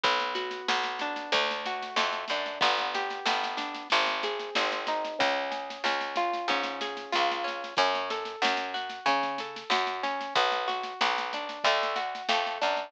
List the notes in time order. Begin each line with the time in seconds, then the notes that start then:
0.04 B1 B3, kick, snare
0.20 snare
0.35 F#4, snare
0.51 snare
0.68 B1 B3, snare
0.83 snare
0.99 D4, snare
1.16 snare
1.32 D2 A3, kick, snare
1.51 snare
1.66 F#4, snare
1.83 snare
1.96 F2 A3, snare
2.13 snare
2.28 F#2 D4, snare
2.46 snare
2.61 G1 B3, kick, snare
2.78 snare
2.94 G4, snare
3.10 snare
3.26 G1 B3, snare
3.44 snare
3.57 D4, snare
3.74 snare
3.90 G#1 C4, kick, snare
4.07 snare
4.23 G#4, snare
4.40 snare
4.55 G#1 C4, snare
4.72 snare
4.87 D#4, snare
5.05 snare
5.19 C#2 C#4, kick, snare
5.51 G#4, snare
5.70 snare
5.84 C#2 C#4, snare
6.01 snare
6.16 F4, snare
6.33 snare
6.48 G#2 C#4, kick, snare
6.64 snare
6.81 G#4, snare
6.97 snare
7.12 C#2 F4, snare
7.32 snare
7.44 C#4, snare
7.64 snare
7.77 F#2 C#4, kick, snare
7.95 snare
8.10 A4, snare
8.25 snare
8.42 F#2 C#4, snare
8.57 snare
8.74 F#4, snare
8.90 snare
9.06 C#3 C#4, kick, snare
9.23 kick, snare
9.38 A4, snare
9.56 snare
9.70 F#2 F#4, snare
9.87 snare
10.03 C#4, snare
10.21 snare
10.35 B1 B3, kick, snare
10.52 snare
10.68 F#4, snare
10.83 snare
11.01 B1 B3, snare
11.18 snare
11.33 D4, snare
11.49 snare
11.64 D2 A3, kick, snare
11.83 snare
11.96 F#4, snare
12.15 snare
12.29 F2 A3, snare
12.47 snare
12.62 F#2 D4, snare
12.77 snare